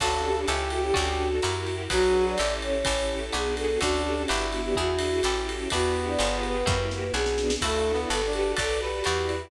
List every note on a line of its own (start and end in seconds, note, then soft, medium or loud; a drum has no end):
0.00 0.45 D2 loud
0.00 0.47 C#4 medium
0.00 0.34 C#4 medium
0.00 0.47 D4 medium
0.00 0.34 D4 medium
0.00 0.22 F#4 medium
0.00 0.47 F#4 medium
0.00 0.34 F#4 medium
0.00 0.47 A4 medium
0.00 0.34 A4 medium
0.00 0.40 A4 loud
0.00 kick medium
0.00 crash loud
0.00 ride loud
0.24 0.35 G4 medium
0.37 0.71 G4 medium
0.47 0.92 C#2 loud
0.47 0.95 C#4 medium
0.47 0.81 C#4 medium
0.47 0.95 E4 medium
0.47 0.81 E4 medium
0.47 1.29 G4 loud
0.47 0.95 G4 medium
0.47 0.81 G4 medium
0.47 0.95 A4 medium
0.47 0.81 A4 loud
0.47 hi-hat pedal loud
0.47 ride loud
0.70 0.83 F#4 medium
0.70 ride medium
0.83 0.94 G4 medium
0.94 1.40 D2 loud
0.94 1.27 C#4 medium
0.94 1.42 C#4 medium
0.94 1.27 D4 medium
0.94 1.42 D4 medium
0.94 1.27 F#4 medium
0.94 1.42 F#4 medium
0.94 1.74 F#4 medium
0.94 1.27 A4 loud
0.94 1.42 A4 medium
0.94 kick medium
0.94 ride loud
1.42 1.88 F#2 loud
1.42 1.90 E4 medium
1.42 1.76 E4 medium
1.42 1.90 F#4 medium
1.42 1.76 F#4 medium
1.42 1.90 G4 medium
1.42 1.76 G4 medium
1.42 1.90 A#4 medium
1.42 1.76 A#4 medium
1.42 hi-hat pedal loud
1.42 ride loud
1.67 ride medium
1.90 2.35 B1 loud
1.90 2.38 F#3 loud
1.90 2.23 D4 medium
1.90 2.38 D4 medium
1.90 2.23 F#4 medium
1.90 2.38 F#4 medium
1.90 2.25 F#4 medium
1.90 2.23 G#4 medium
1.90 2.38 G#4 medium
1.90 2.23 B4 medium
1.90 2.38 B4 medium
1.90 kick medium
1.90 ride loud
2.26 2.55 D5 medium
2.38 2.84 A1 loud
2.38 2.85 C#4 medium
2.38 2.72 C#4 medium
2.38 2.85 E4 medium
2.38 2.72 E4 medium
2.38 2.85 G4 medium
2.38 2.72 G4 medium
2.38 2.85 A4 medium
2.38 2.72 A4 medium
2.38 hi-hat pedal loud
2.38 ride loud
2.62 3.26 C#5 medium
2.62 ride medium
2.85 3.30 A1 loud
2.85 3.19 C#4 medium
2.85 3.33 C#4 medium
2.85 3.19 E4 medium
2.85 3.33 E4 medium
2.85 3.19 G4 medium
2.85 3.33 G4 medium
2.85 3.19 A4 medium
2.85 3.33 A4 medium
2.85 kick medium
2.85 ride loud
3.32 3.78 B1 loud
3.32 3.66 B3 medium
3.32 3.80 B3 medium
3.32 3.66 D4 medium
3.32 3.80 D4 medium
3.32 3.66 F#4 medium
3.32 3.80 F#4 medium
3.32 3.66 G#4 medium
3.32 3.80 G#4 medium
3.32 3.55 G#4 medium
3.32 hi-hat pedal loud
3.32 ride medium
3.57 3.79 A4 medium
3.57 ride loud
3.80 4.26 D2 loud
3.80 4.28 C#4 medium
3.80 4.14 C#4 medium
3.80 4.28 D4 medium
3.80 4.14 D4 medium
3.80 4.22 D4 loud
3.80 4.03 F#4 medium
3.80 4.28 F#4 medium
3.80 4.14 F#4 medium
3.80 4.28 A4 medium
3.80 4.14 A4 medium
3.80 kick medium
3.80 ride loud
4.05 4.15 G4 medium
4.15 4.45 G4 medium
4.27 4.74 G1 loud
4.27 4.76 B3 medium
4.27 4.62 B3 medium
4.27 4.76 D4 medium
4.27 4.62 D4 medium
4.27 5.21 E4 medium
4.27 4.76 F#4 medium
4.27 4.62 F#4 medium
4.27 4.76 G4 medium
4.27 4.62 G4 medium
4.27 hi-hat pedal loud
4.27 ride loud
4.52 4.63 F#4 medium
4.52 ride medium
4.64 4.76 G4 medium
4.75 5.21 E2 loud
4.75 5.23 D4 medium
4.75 5.10 D4 medium
4.75 5.23 E4 medium
4.75 5.10 E4 medium
4.75 5.23 F#4 medium
4.75 5.10 F#4 medium
4.75 5.69 F#4 medium
4.75 5.23 G#4 medium
4.75 5.10 G#4 medium
4.75 kick medium
4.99 ride loud
5.23 5.68 A1 loud
5.23 5.71 C#4 medium
5.23 5.58 C#4 medium
5.23 5.71 E4 medium
5.23 5.58 E4 medium
5.23 5.71 G4 medium
5.23 5.58 G4 medium
5.23 5.71 A4 medium
5.23 5.58 A4 medium
5.23 hi-hat pedal loud
5.23 ride loud
5.49 ride loud
5.70 6.16 E2 loud
5.70 6.75 B3 loud
5.70 6.19 D4 medium
5.70 6.05 D4 medium
5.70 6.19 E4 medium
5.70 6.05 E4 medium
5.70 6.19 F#4 medium
5.70 6.05 F#4 medium
5.70 6.06 F#4 medium
5.70 6.19 G4 medium
5.70 6.05 G4 medium
5.70 kick medium
5.70 ride loud
6.07 6.38 D5 medium
6.19 6.64 G1 loud
6.19 6.52 B3 medium
6.19 6.66 B3 medium
6.19 6.52 F4 medium
6.19 6.66 F4 medium
6.19 6.52 G4 medium
6.19 6.66 G4 medium
6.19 6.52 G#4 loud
6.19 6.66 G#4 medium
6.19 hi-hat pedal medium
6.19 ride loud
6.43 7.12 B4 medium
6.43 ride medium
6.66 7.11 F#2 loud
6.66 6.99 A#3 medium
6.66 7.14 A#3 medium
6.66 6.99 E4 medium
6.66 7.14 E4 medium
6.66 6.99 F#4 medium
6.66 7.14 F#4 medium
6.66 6.99 G4 loud
6.66 7.14 G4 medium
6.66 kick loud
6.66 snare medium
6.91 snare medium
7.14 7.57 B1 loud
7.14 7.47 B3 medium
7.14 7.61 B3 medium
7.14 7.47 D4 medium
7.14 7.61 D4 medium
7.14 7.47 F#4 medium
7.14 7.61 F#4 medium
7.14 7.55 G#4 medium
7.14 7.47 G#4 medium
7.14 7.61 G#4 medium
7.14 snare medium
7.26 snare loud
7.38 snare loud
7.50 snare loud
7.61 8.06 D2 loud
7.61 7.91 A3 medium
7.61 8.09 D4 medium
7.61 7.95 D4 medium
7.61 8.09 E4 medium
7.61 7.95 E4 medium
7.61 8.09 F#4 medium
7.61 7.95 F#4 medium
7.61 8.00 A4 medium
7.61 8.09 A4 medium
7.61 7.95 A4 medium
7.61 kick medium
7.61 crash loud
7.61 ride loud
7.93 8.21 B3 medium
8.10 8.54 G1 loud
8.10 8.57 F#4 medium
8.10 8.43 F#4 medium
8.10 8.57 G4 medium
8.10 8.43 G4 medium
8.10 8.57 A4 medium
8.10 8.33 A4 medium
8.10 8.43 A4 medium
8.10 8.57 B4 medium
8.10 8.43 B4 medium
8.10 hi-hat pedal loud
8.10 ride loud
8.26 8.55 D4 medium
8.33 8.53 G4 medium
8.33 ride medium
8.57 9.02 B1 loud
8.57 8.90 F#4 medium
8.57 9.04 F#4 medium
8.57 8.90 A4 medium
8.57 9.04 A4 medium
8.57 8.81 A4 medium
8.57 8.90 B4 medium
8.57 9.04 B4 medium
8.57 8.90 D5 medium
8.57 8.79 D5 medium
8.57 9.04 D5 medium
8.57 kick medium
8.57 ride loud
8.81 9.43 G4 medium
8.81 9.50 B4 medium
9.04 9.50 E2 loud
9.04 9.50 E4 medium
9.04 9.39 E4 medium
9.04 9.50 F#4 medium
9.04 9.39 F#4 medium
9.04 9.50 G4 medium
9.04 9.39 G4 medium
9.04 9.50 D5 medium
9.04 9.39 D5 medium
9.04 hi-hat pedal loud
9.04 ride loud
9.29 ride medium